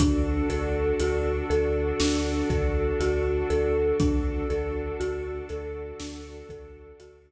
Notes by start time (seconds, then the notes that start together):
0.00 D2 D4 F#4 A4, kick, closed hi-hat
0.50 D2 A4, closed hi-hat
1.00 D2 F#4, closed hi-hat
1.50 D2 A4, closed hi-hat
2.00 D2 D4, snare
2.50 D2 A4, kick, closed hi-hat
3.00 D2 F#4, closed hi-hat
3.50 D2 A4, closed hi-hat
3.98 D2 D4 F#4 A4, kick, closed hi-hat
4.50 D2 A4, closed hi-hat
5.00 D2 F#4, closed hi-hat
5.49 D2 A4, closed hi-hat
6.00 D2 D4, snare
6.49 D2 A4, kick, closed hi-hat
7.00 D2 F#4, closed hi-hat